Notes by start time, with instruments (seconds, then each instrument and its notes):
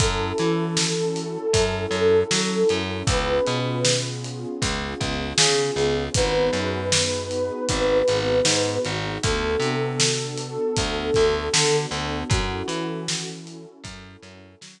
0.00 electric bass (finger) F#2, pad 2 (warm) C#4 E4 F#4 A4, ocarina A4, kick, closed hi-hat
0.38 electric bass (finger) E3, closed hi-hat
0.77 pad 2 (warm) C#4 E4 F#4 A4, snare
1.16 closed hi-hat
1.53 electric bass (finger) F#2, pad 2 (warm) C#4 E4 F#4 A4, kick, closed hi-hat
1.91 electric bass (finger) F#2, closed hi-hat
2.31 electric bass (finger) F#3, pad 2 (warm) C#4 E4 F#4 A4, snare
2.69 electric bass (finger) F#2, closed hi-hat
3.07 electric bass (finger) C#2, pad 2 (warm) B3 C#4 F4 G#4, ocarina B4, kick, closed hi-hat
3.46 electric bass (finger) B2, closed hi-hat
3.85 pad 2 (warm) B3 C#4 F4 G#4, snare
4.24 closed hi-hat
4.62 electric bass (finger) C#2, pad 2 (warm) B3 C#4 F4 G#4, kick, closed hi-hat
5.00 electric bass (finger) C#2, kick, closed hi-hat
5.38 electric bass (finger) C#3, pad 2 (warm) B3 C#4 F4 G#4, ocarina G#4, snare
5.76 electric bass (finger) C#2, closed hi-hat
6.14 electric bass (finger) G#1, pad 2 (warm) B3 D#4 F#4 G#4, ocarina B4, kick, closed hi-hat
6.53 electric bass (finger) F#2, closed hi-hat
6.92 pad 2 (warm) B3 D#4 F#4 G#4, snare
7.31 closed hi-hat
7.69 electric bass (finger) G#1, pad 2 (warm) B3 D#4 F#4 G#4, kick, closed hi-hat
8.08 electric bass (finger) G#1, snare, closed hi-hat
8.45 electric bass (finger) G#2, pad 2 (warm) B3 D#4 F#4 G#4, snare
8.85 electric bass (finger) G#1, closed hi-hat
9.23 electric bass (finger) D2, pad 2 (warm) B3 D4 F#4 A4, ocarina A4, kick, closed hi-hat
9.60 electric bass (finger) C3, closed hi-hat
10.00 pad 2 (warm) B3 D4 F#4 A4, snare
10.38 closed hi-hat
10.76 electric bass (finger) D2, pad 2 (warm) B3 D4 F#4 A4, kick, closed hi-hat
11.14 electric bass (finger) D2, kick, snare, closed hi-hat
11.53 electric bass (finger) D3, pad 2 (warm) B3 D4 F#4 A4, snare
11.91 electric bass (finger) D2, closed hi-hat
12.30 electric bass (finger) F#2, pad 2 (warm) C#4 E4 F#4 A4, ocarina F#4, kick, closed hi-hat
12.68 electric bass (finger) E3, closed hi-hat
13.08 pad 2 (warm) C#4 E4 F#4 A4, snare
13.47 closed hi-hat
13.84 electric bass (finger) F#2, pad 2 (warm) C#4 E4 F#4 A4, kick, closed hi-hat
14.22 electric bass (finger) F#2, closed hi-hat
14.61 electric bass (finger) F#3, pad 2 (warm) C#4 E4 F#4 A4, snare